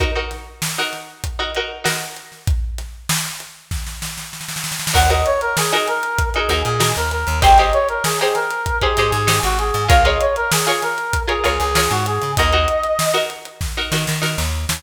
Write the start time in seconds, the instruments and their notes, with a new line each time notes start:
0.00 pizzicato strings D#4 F#4 A#4, kick, closed hi-hat
0.15 pizzicato strings D#4 F#4 A#4
0.31 snare, closed hi-hat
0.62 snare
0.77 pizzicato strings D#4 F#4 A#4, snare
0.93 snare, closed hi-hat
1.24 kick, closed hi-hat
1.39 pizzicato strings D#4 F#4 A#4
1.55 pizzicato strings D#4 F#4 A#4, closed hi-hat
1.84 pizzicato strings D#4 F#4 A#4, snare
2.16 closed hi-hat
2.32 snare
2.47 kick, closed hi-hat
2.78 snare, closed hi-hat
3.09 snare
3.40 closed hi-hat
3.71 kick, snare
3.87 snare
4.02 snare
4.18 snare
4.33 snare
4.41 snare
4.48 snare
4.56 snare
4.64 snare
4.72 snare
4.79 snare
4.87 snare
4.94 electric bass (finger) D#2, pizzicato strings D#4 F#4 A#4, brass section F#5, kick, crash
5.10 pizzicato strings D#4 F#4 A#4, brass section D#5, closed hi-hat
5.26 brass section C#5, closed hi-hat
5.41 brass section A#4, closed hi-hat
5.57 brass section G#4, snare
5.72 pizzicato strings D#4 F#4 A#4, brass section G#4, snare, closed hi-hat
5.88 brass section A#4, closed hi-hat
6.03 closed hi-hat
6.19 kick, closed hi-hat
6.34 pizzicato strings D#4 F#4 A#4, brass section G#4, closed hi-hat
6.49 electric bass (finger) D#2, pizzicato strings D#4 F#4 A#4, closed hi-hat
6.64 electric bass (finger) A#2, brass section G#4, closed hi-hat
6.80 pizzicato strings D#4 F#4 A#4, snare
6.96 electric bass (finger) D#2, brass section A#4, closed hi-hat
7.11 brass section A#4, closed hi-hat
7.27 electric bass (finger) D#2, closed hi-hat
7.42 electric bass (finger) G#1, pizzicato strings D#4 G4 G#4 C5, brass section G5, kick, closed hi-hat
7.58 pizzicato strings D#4 G4 G#4 C5, brass section D#5, snare, closed hi-hat
7.73 brass section C#5, closed hi-hat
7.89 brass section A#4, closed hi-hat
8.04 brass section G#4, snare
8.19 pizzicato strings D#4 G4 G#4 C5, brass section G#4, closed hi-hat
8.35 brass section A#4, snare, closed hi-hat
8.51 closed hi-hat
8.66 kick, closed hi-hat
8.81 pizzicato strings D#4 G4 G#4 C5, brass section G#4, kick, closed hi-hat
8.97 electric bass (finger) G#2, pizzicato strings D#4 G4 G#4 C5, closed hi-hat
9.12 electric bass (finger) G#2, brass section G#4, snare, closed hi-hat
9.27 pizzicato strings D#4 G4 G#4 C5, snare
9.43 electric bass (finger) G#1, brass section F#4, closed hi-hat
9.59 brass section G#4, closed hi-hat
9.74 electric bass (finger) G#2, snare, closed hi-hat
9.88 electric bass (finger) C#2, pizzicato strings F4 G#4 A#4 C#5, brass section F5, kick, closed hi-hat
10.05 pizzicato strings F4 G#4 A#4 C#5, brass section D#5, closed hi-hat
10.21 brass section C#5, closed hi-hat
10.36 brass section A#4, closed hi-hat
10.51 brass section G#4, snare
10.67 pizzicato strings F4 G#4 A#4 C#5, brass section G#4, closed hi-hat
10.82 brass section A#4, snare, closed hi-hat
10.98 closed hi-hat
11.13 kick, closed hi-hat
11.27 pizzicato strings F4 G#4 A#4 C#5, brass section G#4, closed hi-hat
11.44 electric bass (finger) C#2, pizzicato strings F4 G#4 A#4 C#5, closed hi-hat
11.60 electric bass (finger) C#2, brass section G#4, snare, closed hi-hat
11.75 pizzicato strings F4 G#4 A#4 C#5, snare
11.91 electric bass (finger) G#2, brass section F#4, closed hi-hat
12.06 brass section G#4, closed hi-hat
12.22 electric bass (finger) C#3, snare, closed hi-hat
12.37 electric bass (finger) D#2, pizzicato strings D#4 F#4 A#4, brass section D#5, kick, closed hi-hat
12.53 pizzicato strings D#4 F#4 A#4, closed hi-hat
12.68 closed hi-hat
12.84 closed hi-hat
12.99 snare
13.14 pizzicato strings D#4 F#4 A#4, closed hi-hat
13.30 closed hi-hat
13.45 closed hi-hat
13.61 kick, snare
13.77 pizzicato strings D#4 F#4 A#4
13.92 electric bass (finger) D#3, pizzicato strings D#4 F#4 A#4, snare
14.07 electric bass (finger) D#3, snare
14.22 pizzicato strings D#4 F#4 A#4, snare
14.38 electric bass (finger) D#2, snare
14.69 electric bass (finger) D#2, snare